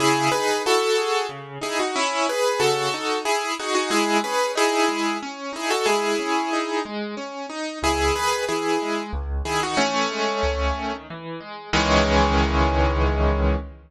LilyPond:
<<
  \new Staff \with { instrumentName = "Acoustic Grand Piano" } { \time 3/4 \key cis \minor \tempo 4 = 92 <e' gis'>8 <gis' b'>8 <fis' a'>4 r8 <e' gis'>16 <dis' fis'>16 | <cis' e'>8 <gis' b'>8 <fis' a'>4 <e' gis'>8 <dis' fis'>16 <dis' fis'>16 | <e' gis'>8 <gis' b'>8 <e' gis'>4 r8 <e' gis'>16 <fis' a'>16 | <e' gis'>4. r4. |
<e' gis'>8 <gis' b'>8 <e' gis'>4 r8 <e' gis'>16 <dis' fis'>16 | <a cis'>2 r4 | cis'2. | }
  \new Staff \with { instrumentName = "Acoustic Grand Piano" } { \time 3/4 \key cis \minor cis8 dis'8 e'8 gis'8 cis8 dis'8 | r4 cis8 dis'8 r8 gis'8 | gis8 cis'8 dis'8 gis8 cis'8 dis'8 | gis8 cis'8 dis'8 gis8 cis'8 dis'8 |
cis,8 dis8 e8 gis8 cis,8 dis8 | e8 gis8 cis,8 dis8 e8 gis8 | <cis, dis e gis>2. | }
>>